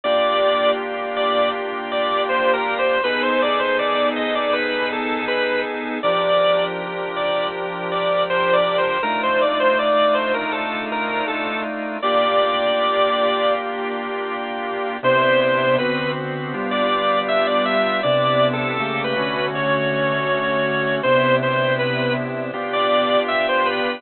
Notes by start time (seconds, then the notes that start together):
0.04 A#3 D4 F4 G4 D5
1.16 D5
1.92 D5
2.29 C5
2.53 A#4
2.79 C5
3.04 B3 D#4 G#4 A4 B4
3.23 C5
3.42 D5
3.59 C5
3.79 D5
4.16 D#5
4.35 D5
4.53 B4
4.93 A4
5.28 B4
6.03 F3 D4 G4 A#4 D5
7.16 D5
7.91 D5
8.30 C5
8.53 D5
8.78 C5
9.03 A3 D4 D#4 F4 A#4
9.23 C5
9.41 D5
9.60 C5
9.79 D5
10.14 C5
10.34 A#4
10.52 A4
10.92 A#4
11.28 A4
12.02 A#3 D4 F4 G4 D5
15.03 C3 B3 D4 E4 C5
15.41 C5
15.78 D3 B3 C4 F#4 B4
16.54 G3 B3 D4 F4
16.71 D5
17.28 E5
17.47 D5
17.65 E5
18.03 C3 B3 D4 E4 D5
18.53 A4
18.79 C#3 A3 A#3 G4
19.04 B4
19.16 D3 A3 C#4 F#4
19.55 C#5
21.03 C3 B3 D4 E4 C5
21.43 C5
21.79 B4
22.53 B3 D4 F4 G4
22.73 D5
23.28 E5
23.49 C5
23.65 B4